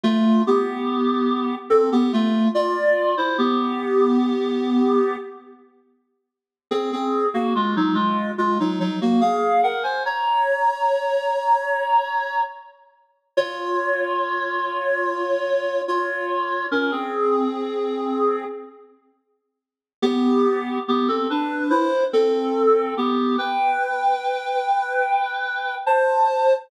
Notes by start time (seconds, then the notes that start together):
0.03 A3 F4
0.47 B3 G4
1.70 C4 A4
1.92 B3 G4
2.13 A3 F4
2.55 F4 D5
3.17 E4 C5
3.38 B3 G4
6.71 C4 G#4
6.93 C4 G#4
7.34 A#3 F#4
7.55 G#3 F4
7.76 F#3 D#4
7.94 G#3 F4
8.38 G#3 F4
8.60 F#3 D#4
8.80 F#3 D#4
9.01 A#3 F#4
9.21 G#4 F5
9.63 A#4 F#5
9.83 C5 G#5
10.05 C#5 A#5
13.37 F4 C#5
15.88 F4 C#5
16.71 C#4 A#4
16.91 C4 G#4
20.02 B3 G4
20.88 B3 G4
21.08 C4 A4
21.30 D4 B4
21.70 E4 C5
22.13 C4 A4
22.97 B3 G4
23.38 B4 G5
25.86 C5 A5